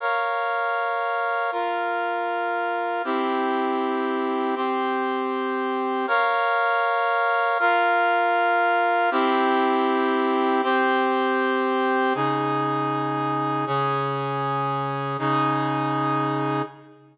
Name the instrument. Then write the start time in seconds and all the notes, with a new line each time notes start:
brass section
0.00 A#4 C#5 F5
1.52 F4 A#4 F5
3.04 C4 E4 G4
4.56 C4 G4 C5
6.07 A#4 C#5 F5
7.59 F4 A#4 F5
9.11 C4 E4 G4
10.63 C4 G4 C5
12.15 C#3 D#4 G#4
13.67 C#3 C#4 G#4
15.19 C#3 D#4 G#4